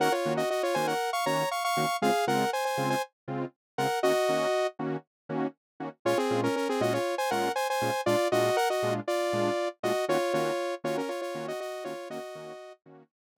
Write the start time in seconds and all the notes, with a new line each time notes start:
0.00 D#3 A#3 C#4 F#4 A#4 F#5
0.12 F4 C#5
0.25 D#3 A#3 C#4 F#4
0.37 F#4 D#5
0.50 F#4 D#5
0.63 F4 C#5
0.74 D#3 A#3 C#4 F#4 C5 G#5
0.87 A#4 F#5
1.13 F5 C#6
1.26 D#3 A#3 C#4 F#4 C#5 A#5
1.51 F5 C#6
1.64 F5 C#6
1.77 D#3 A#3 C#4 F#4
2.02 C#3 G#3 C4 F4 G#4 F5
2.27 C#3 G#3 C4 F4 A#4 F#5
2.53 C5 G#5
2.65 C5 G#5
2.77 C#3 G#3 C4 F4
2.90 C5 G#5
3.28 C#3 G#3 C4 F4
3.78 C#3 G#3 C4 F4 A#4 F#5
4.03 D#3 A#3 C#4 F#4 D#5
4.29 D#3 A#3 C#4 F#4
4.79 D#3 A#3 C#4 F#4
5.29 D#3 A#3 C#4 F#4
5.80 D#3 A#3 C#4 F#4
6.05 A#2 G#3 C#4 F4 C#5
6.18 C4 G#4
6.30 A#2 G#3 C#4 F4
6.43 C#4 A#4
6.56 C#4 A#4
6.69 C4 G#4
6.81 A#2 G#3 C#4 F4 F#4 D#5
6.93 F4 C#5
7.18 C5 G#5
7.31 A#2 G#3 C#4 F4 A#4 F#5
7.56 C5 G#5
7.70 C5 G#5
7.82 A#2 G#3 C#4 F4
8.06 A#2 G#3 D4 F4 D5
8.32 A#2 G#3 D4 F4 F#4 D#5
8.57 A#4 F#5
8.70 F#4 D#5
8.83 A#2 G#3 D4 F4
9.08 F4 D5
9.33 A#2 G#3 D4 F4
9.83 A#2 G#3 D4 F4 F#4 D#5
10.08 D#3 A#3 C#4 F4 F#4 C#5
10.33 D#3 A#3 C#4 F4 F#4 C#5
10.84 D#3 A#3 C#4 F4 F#4 C#5
10.97 C#4 A#4
11.09 F4 C#5
11.21 F4 C#5
11.35 D#3 A#3 C#4 F#4
11.48 F#4 D#5
11.60 F#4 D#5
11.84 D#3 A#3 C#4 F4 F#4 C#5
12.10 D#3 A#3 C#4 F#4 D#5
12.35 D#3 A#3 C#4 F#4
12.86 D#3 A#3 C#4 F#4
13.36 D#3 A#3 C#4 F#4